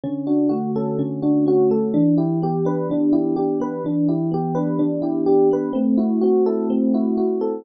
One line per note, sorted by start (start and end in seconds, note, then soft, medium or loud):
0.04 0.98 D3 loud
0.04 0.25 C#4 medium
0.27 0.49 D4 medium
0.27 1.22 F#4 medium
0.49 1.70 A3 medium
0.49 0.71 F#4 medium
0.75 1.46 C#4 medium
0.75 0.98 A4 medium
0.98 1.89 D3 medium
0.98 1.21 C#4 medium
1.22 1.45 D4 medium
1.22 1.90 F#4 medium
1.46 1.92 C#4 medium
1.46 1.70 F#4 medium
1.70 1.93 A3 medium
1.70 1.93 A4 soft
1.94 2.89 E3 loud
1.94 2.16 D4 medium
2.17 2.39 E4 medium
2.17 3.12 G4 medium
2.42 3.60 B3 medium
2.42 2.65 G4 medium
2.65 3.36 D4 medium
2.65 2.88 B4 medium
2.90 3.80 E3 medium
2.90 3.13 D4 medium
3.13 3.35 E4 medium
3.13 3.81 G4 medium
3.36 3.82 D4 medium
3.36 3.58 G4 medium
3.60 3.83 B3 medium
3.60 3.83 B4 medium
3.84 4.79 E3 medium
3.84 4.08 D4 medium
4.08 4.30 E4 medium
4.08 5.02 G4 medium
4.31 5.51 B3 medium
4.31 4.56 G4 medium
4.55 5.27 D4 medium
4.55 4.77 B4 medium
4.79 5.70 E3 medium
4.79 5.01 D4 medium
5.02 5.24 E4 medium
5.02 5.71 G4 medium
5.26 5.73 D4 medium
5.26 5.48 G4 medium
5.51 5.74 B3 medium
5.51 5.75 B4 medium
5.73 6.69 A3 loud
5.73 5.95 C4 medium
5.97 6.19 E4 medium
5.97 6.94 F#4 medium
6.21 7.41 C4 medium
6.21 6.43 F#4 medium
6.46 7.17 E4 medium
6.46 6.68 A4 medium
6.70 7.60 A3 medium
6.70 6.92 C4 medium
6.94 7.17 E4 medium
6.94 7.62 F#4 medium
7.17 7.63 E4 medium
7.17 7.39 F#4 medium
7.41 7.64 C4 medium
7.41 7.63 A4 medium